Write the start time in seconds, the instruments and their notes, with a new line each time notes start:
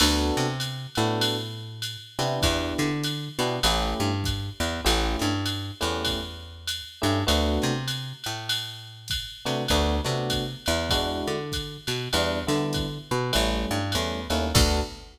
0.00 electric bass (finger) D2, electric piano 1 B3 D4 F#4 A4, crash, ride
0.37 electric bass (finger) C3, snare
0.60 hi-hat pedal, ride
0.95 electric bass (finger) A2, electric piano 1 B3 D4 F#4 A4, ride
1.21 ride
1.82 hi-hat pedal, ride
2.19 electric bass (finger) C3, electric piano 1 B3 D4 E4 G4, ride
2.42 electric bass (finger) E2, kick, ride
2.78 electric bass (finger) D3, snare
3.03 hi-hat pedal, ride
3.39 electric bass (finger) B2, electric piano 1 B3 D4 E4 G4, ride
3.63 electric bass (finger) A1, electric piano 1 A3 C#4 E4 G4, ride
4.00 electric bass (finger) G2
4.24 kick, hi-hat pedal, ride
4.60 electric bass (finger) E2, ride
4.84 electric bass (finger) A1, electric piano 1 A3 C#4 E4 G4, ride
5.19 electric bass (finger) G2, snare
5.46 hi-hat pedal, ride
5.81 electric bass (finger) E2, electric piano 1 A3 C#4 E4 G4, ride
6.05 kick, ride
6.67 hi-hat pedal, ride
7.02 electric bass (finger) G2, electric piano 1 A3 C#4 E4 G4, ride
7.27 electric bass (finger) D2, electric piano 1 A3 B3 D4 F#4, ride
7.62 electric bass (finger) C3, snare
7.88 hi-hat pedal, ride
8.24 electric bass (finger) A2, ride
8.49 ride
9.08 kick, hi-hat pedal, ride
9.45 electric bass (finger) C3, electric piano 1 A3 B3 D4 F#4, ride
9.68 electric bass (finger) D2, electric piano 1 A3 B3 D4 F#4, kick, ride
10.04 electric bass (finger) C3, electric piano 1 A3 B3 D4 F#4, snare
10.30 kick, hi-hat pedal, ride
10.66 electric bass (finger) E2, ride
10.90 electric piano 1 G#3 D4 E4 F#4, kick, ride
11.27 electric bass (finger) D3
11.52 kick, hi-hat pedal, ride
11.87 electric bass (finger) B2, ride
12.13 electric bass (finger) E2, electric piano 1 G3 B3 D4 E4, ride
12.47 electric bass (finger) D3, electric piano 1 G3 B3 D4 E4, snare
12.73 kick, hi-hat pedal, ride
13.11 electric bass (finger) B2
13.33 electric bass (finger) A1, electric piano 1 G3 A3 C#4 E4, ride
13.71 electric bass (finger) G2
13.92 electric bass (finger) E2, electric piano 1 G3 A3 C#4 E4, hi-hat pedal, ride
14.30 electric bass (finger) D#2, electric piano 1 G3 A3 C#4 E4, ride
14.55 electric bass (finger) D2, electric piano 1 B3 D4 F#4 A4, kick, crash